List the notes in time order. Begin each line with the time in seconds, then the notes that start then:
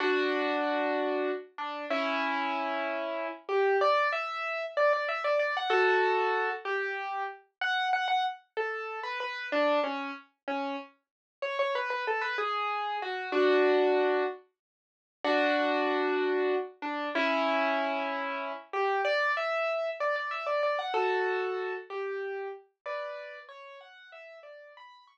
0.00 D4 F#4
1.58 D4
1.90 C#4 E4
3.49 G4
3.81 D5
4.12 E5
4.77 D5
4.93 D5
5.08 E5
5.24 D5
5.39 D5
5.57 F#5
5.70 F#4 A4
6.65 G4
7.61 F#5
7.93 F#5
8.08 F#5
8.57 A4
9.03 B4
9.20 B4
9.52 D4
9.84 C#4
10.48 C#4
11.42 C#5
11.59 C#5
11.75 B4
11.90 B4
12.07 A4
12.21 B4
12.38 G#4
13.02 F#4
13.32 D4 F#4
15.24 D4 F#4
16.82 D4
17.15 C#4 E4
18.73 G4
19.05 D5
19.37 E5
20.00 D5
20.16 D5
20.31 E5
20.46 D5
20.63 D5
20.79 F#5
20.94 F#4 A4
21.90 G4
22.86 B4 D5
23.49 C#5
23.81 F#5
24.12 E5
24.43 D5
24.77 B5
25.07 C#6